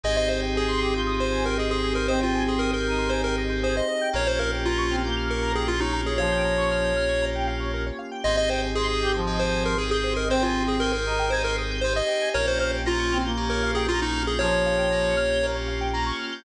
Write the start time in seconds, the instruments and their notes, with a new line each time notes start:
0.04 synth bass 2 G#1, electric piano 2 C4 D#4 G4 G#4, pad 2 (warm) C4 D#4 G4 G#4, lead 1 (square) G#4 D#5
0.17 lead 1 (square) C5 D#5
0.28 lead 1 (square) C5 D#5
0.43 lead 1 (square) G5
0.55 lead 1 (square) G#4 G#5
0.68 lead 1 (square) C6
0.81 brass section G4, lead 1 (square) D#6
0.94 brass section F4, lead 1 (square) G6
1.07 lead 1 (square) D#6
1.19 lead 1 (square) C5 C6
1.32 lead 1 (square) G#5
1.45 lead 1 (square) A#4 G5
1.58 lead 1 (square) G#4 D#5
1.70 lead 1 (square) G#4 C5
1.83 lead 1 (square) G#4
1.95 lead 1 (square) A#4 C5
2.08 brass section C4, lead 1 (square) C5 D#5
2.21 lead 1 (square) F4 G5
2.35 lead 1 (square) G#5
2.47 lead 1 (square) G#4 C6
2.59 lead 1 (square) A#4 D#6
2.73 lead 1 (square) A#4 G6
2.86 brass section D#4, lead 1 (square) D#6
2.98 lead 1 (square) C6
3.10 lead 1 (square) C5 G#5
3.24 lead 1 (square) A#4 G5
3.38 lead 1 (square) D#5
3.49 lead 1 (square) C5
3.63 lead 1 (square) G#4 C5
3.75 lead 1 (square) C5 D#5
3.88 lead 1 (square) D#5
4.01 lead 1 (square) G5
4.13 synth bass 2 A#1, electric piano 2 A#3 C#4 F4 G4, pad 2 (warm) A#3 C#4 F4 G4, lead 1 (square) A#4 C#5
4.27 lead 1 (square) C5 C#5
4.39 lead 1 (square) A#4 F5
4.53 lead 1 (square) G5
4.65 lead 1 (square) F4 A#5
4.78 lead 1 (square) C#6
4.90 brass section C4, lead 1 (square) F6
5.04 brass section A#3, lead 1 (square) G6
5.17 lead 1 (square) F6
5.29 lead 1 (square) A#4 C#6
5.42 lead 1 (square) A#5
5.55 lead 1 (square) G#4 G5
5.68 lead 1 (square) F4 F5
5.80 lead 1 (square) D#4 C#5
5.93 lead 1 (square) A#4
6.06 lead 1 (square) G#4 C#5
6.18 brass section F3, lead 1 (square) C#5 F5
6.32 lead 1 (square) G5
6.45 lead 1 (square) A#5
6.57 lead 1 (square) C#6
6.71 lead 1 (square) F6
6.84 lead 1 (square) G6
6.96 lead 1 (square) F6
7.09 lead 1 (square) C#6
7.22 lead 1 (square) A#5
7.35 lead 1 (square) G5
7.47 lead 1 (square) F5
7.60 lead 1 (square) C#5
7.74 lead 1 (square) A#4
7.86 lead 1 (square) C#5
7.99 lead 1 (square) F5
8.11 lead 1 (square) G5
8.24 synth bass 2 G#1, electric piano 2 C4 D#4 G4 G#4, pad 2 (warm) C4 D#4 G4 G#4, lead 1 (square) C5 D#5
8.37 lead 1 (square) D#5
8.49 lead 1 (square) C5 G5
8.63 lead 1 (square) G#5
8.75 electric piano 2 C4 D#4 G4 G#4, lead 1 (square) G#4 C6
8.88 lead 1 (square) D#6
9.01 brass section G4, lead 1 (square) G6
9.14 brass section F3, lead 1 (square) C5
9.27 electric piano 2 C4 D#4 G4 G#4, lead 1 (square) D#5
9.39 lead 1 (square) C5 G5
9.53 lead 1 (square) G#5
9.65 lead 1 (square) A#4 C6
9.78 electric piano 2 C4 D#4 G4 G#4, lead 1 (square) G#4 D#6
9.91 lead 1 (square) G#4 G6
10.04 lead 1 (square) C5
10.17 lead 1 (square) A#4 D#5
10.29 brass section C4, electric piano 2 C4 D#4 G4 G#4, lead 1 (square) C5 G5
10.42 lead 1 (square) F4 G#5
10.56 lead 1 (square) C6
10.67 lead 1 (square) G#4 D#6
10.80 electric piano 2 C4 D#4 G4 G#4, lead 1 (square) A#4 G6
10.93 lead 1 (square) A#4 C5
11.06 brass section D#4, lead 1 (square) D#5
11.19 lead 1 (square) G5
11.30 electric piano 2 C4 D#4 G4 G#4, lead 1 (square) C5 G#5
11.44 lead 1 (square) A#4 C6
11.58 lead 1 (square) D#6
11.71 lead 1 (square) G6
11.81 electric piano 2 C4 D#4 G4 G#4, lead 1 (square) C5
11.96 lead 1 (square) D#5
12.08 lead 1 (square) G5
12.22 lead 1 (square) G#5
12.34 synth bass 2 A#1, electric piano 2 A#3 C#4 F4 G4, pad 2 (warm) A#3 C#4 F4 G4, lead 1 (square) A#4 C#5
12.47 lead 1 (square) C5 C#5
12.59 lead 1 (square) C5 F5
12.72 lead 1 (square) G5
12.85 electric piano 2 A#3 C#4 F4 G4, lead 1 (square) F4 A#5
12.99 lead 1 (square) C#6
13.12 brass section C4, lead 1 (square) F6
13.25 brass section A#3, lead 1 (square) G6
13.37 electric piano 2 A#3 C#4 F4 G4, lead 1 (square) A#4
13.50 lead 1 (square) A#4 C#5
13.63 lead 1 (square) F5
13.75 lead 1 (square) G#4 G5
13.88 electric piano 2 A#3 C#4 F4 G4, lead 1 (square) F4 A#5
14.02 lead 1 (square) D#4 C#6
14.14 lead 1 (square) F6
14.27 lead 1 (square) G#4 G6
14.39 brass section F3, electric piano 2 A#3 C#4 F4 G4, lead 1 (square) A#4 C#5
14.52 lead 1 (square) C#5
14.66 lead 1 (square) F5
14.78 lead 1 (square) G5
14.91 electric piano 2 A#3 C#4 F4 G4, lead 1 (square) A#5
15.04 lead 1 (square) C#6
15.17 lead 1 (square) F6
15.30 lead 1 (square) G6
15.43 electric piano 2 A#3 C#4 F4 G4, lead 1 (square) A#4
15.55 lead 1 (square) C#5
15.68 lead 1 (square) F5
15.81 lead 1 (square) G5
15.93 electric piano 2 A#3 C#4 F4 G4, lead 1 (square) A#5
16.06 lead 1 (square) C#6
16.19 lead 1 (square) F6
16.32 lead 1 (square) G6